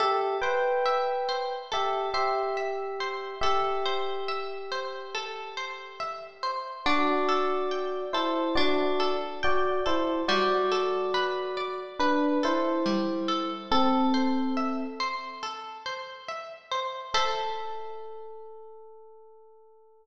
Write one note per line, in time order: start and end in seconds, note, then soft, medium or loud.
0.00 0.37 G4 loud
0.00 1.71 A4 loud
0.00 0.37 E5 loud
0.42 1.54 B4 medium
0.42 1.28 C5 medium
0.42 1.54 G5 loud
0.86 2.56 E5 medium
1.29 2.14 C5 medium
1.72 2.09 G4 medium
1.72 3.34 A4 medium
1.72 2.09 E5 loud
2.14 3.35 G4 medium
2.14 3.00 C5 medium
2.14 3.35 E5 loud
2.57 3.38 E5 medium
3.00 3.41 C5 medium
3.41 6.55 G4 medium
3.41 5.14 A4 loud
3.41 6.55 E5 loud
3.86 4.71 C5 loud
4.28 5.99 E5 medium
4.72 5.57 C5 medium
5.15 6.78 A4 medium
5.57 6.43 C5 medium
6.00 6.81 E5 medium
6.43 6.84 C5 medium
6.86 8.57 D4 loud
6.86 8.02 F#4 loud
6.86 8.02 D5 loud
7.29 8.14 A4 medium
7.71 9.43 G5 medium
8.13 8.54 E4 loud
8.13 8.99 A4 medium
8.13 8.54 C5 loud
8.55 10.20 D4 loud
8.55 9.12 F#4 medium
8.55 9.12 D5 loud
9.00 9.85 A4 medium
9.43 9.79 F#4 medium
9.43 9.79 D5 loud
9.43 10.24 G5 medium
9.86 10.22 E4 medium
9.86 10.26 A4 medium
9.86 10.22 C5 loud
10.28 12.85 G3 loud
10.28 11.78 F#4 loud
10.28 11.78 D5 loud
10.72 12.43 A4 medium
11.14 12.00 B4 loud
11.57 13.61 D5 medium
11.99 12.38 D4 loud
11.99 12.38 B4 loud
11.99 13.63 B4 medium
12.43 13.49 E4 loud
12.43 13.28 A4 medium
12.43 13.49 C5 loud
12.86 13.67 G3 medium
13.28 13.69 A4 medium
13.71 14.84 C4 loud
13.71 14.84 A4 loud
13.71 15.42 A4 loud
14.14 14.99 C5 medium
14.57 16.28 E5 medium
15.00 15.85 C5 medium
15.43 17.06 A4 medium
15.86 16.71 C5 medium
16.28 17.10 E5 medium
16.71 17.12 C5 medium
17.14 20.06 A4 loud
17.14 20.06 C5 loud
17.14 20.06 E5 loud